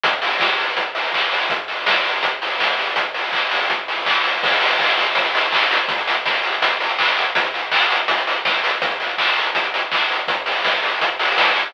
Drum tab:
CC |----------------|----------------|----------------|x---------------|
HH |x-o---o-x-o---o-|x-o---o-x-o---o-|x-o---o-x-o---o-|-xox-xoxxxox-xox|
CP |------------x---|----------------|----x-------x---|----x-------x---|
SD |----o-----------|----o-------o---|----------------|----------------|
BD |o---o---o---o---|o---o---o---o---|o---o---o---o---|o---o---o---o---|

CC |----------------|----------------|----------------|----------------|
HH |xxox-xoxxxox-xox|xxox-xoxxxox-xox|xxox-xoxxxox-xox|x-o---o-x-o---o-|
CP |------------x---|----x-----------|----x-------x---|----------------|
SD |----o-----------|------------o---|----------------|----o-------o---|
BD |o---o---o---o---|o---o---o---o---|o---o---o---o---|o---o---o---o---|